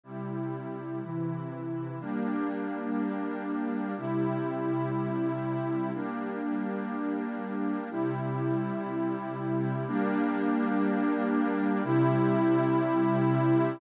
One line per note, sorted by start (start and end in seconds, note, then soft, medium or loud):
0.03 1.01 C3 medium
0.03 1.01 G3 medium
0.03 1.01 E4 medium
1.02 1.99 C3 medium
1.02 1.99 E3 medium
1.02 1.99 E4 medium
2.00 3.95 G3 medium
2.00 3.95 A#3 medium
2.00 3.95 D4 medium
3.97 5.92 C3 medium
3.97 5.92 G3 medium
3.97 5.92 E4 loud
5.94 7.89 G3 medium
5.94 7.89 A#3 medium
5.94 7.89 D4 medium
7.90 9.85 C3 medium
7.90 9.85 G3 medium
7.90 9.85 E4 medium
9.87 11.82 G3 loud
9.87 11.82 A#3 loud
9.87 11.82 D4 loud
11.84 13.79 C3 loud
11.84 13.79 G3 loud
11.84 13.79 E4 loud